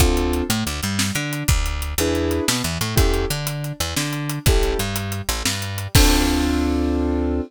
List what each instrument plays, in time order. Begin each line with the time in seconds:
0.00 electric bass (finger) D2, acoustic grand piano C4 D4 F4 A4, kick, closed hi-hat
0.17 closed hi-hat
0.33 closed hi-hat
0.49 electric bass (finger) A2, acoustic grand piano A3, closed hi-hat
0.65 electric bass (finger) D2, acoustic grand piano D3, closed hi-hat
0.83 electric bass (finger) G2, acoustic grand piano G3, closed hi-hat
0.99 snare
1.15 electric bass (finger) D3, acoustic grand piano D4, closed hi-hat
1.33 closed hi-hat
1.48 electric bass (finger) D2, kick, closed hi-hat
1.66 closed hi-hat
1.82 closed hi-hat
1.98 electric bass (finger) E2, acoustic grand piano D4 E4 G#4 B4, closed hi-hat
2.15 closed hi-hat
2.31 closed hi-hat
2.48 electric bass (finger) B2, acoustic grand piano B3, snare
2.64 electric bass (finger) E2, acoustic grand piano E3, closed hi-hat
2.81 electric bass (finger) A2, acoustic grand piano A3, closed hi-hat
2.96 electric bass (finger) E2, acoustic grand piano C#4 E4 G4 A4, kick, closed hi-hat
3.14 closed hi-hat
3.30 electric bass (finger) D3, acoustic grand piano D4, closed hi-hat
3.47 closed hi-hat
3.64 closed hi-hat
3.80 electric bass (finger) E2, acoustic grand piano E3, closed hi-hat
3.96 electric bass (finger) D3, acoustic grand piano D4, snare
4.13 closed hi-hat
4.29 closed hi-hat
4.46 electric bass (finger) A1, acoustic grand piano C#4 E4 G4 A4, kick, closed hi-hat
4.63 closed hi-hat
4.79 electric bass (finger) G2, acoustic grand piano G3, closed hi-hat
4.96 closed hi-hat
5.12 closed hi-hat
5.29 electric bass (finger) A1, acoustic grand piano A3, closed hi-hat
5.45 electric bass (finger) G2, acoustic grand piano G3, snare
5.62 closed hi-hat
5.78 closed hi-hat
5.95 electric bass (finger) D2, acoustic grand piano C4 D4 F4 A4, kick, crash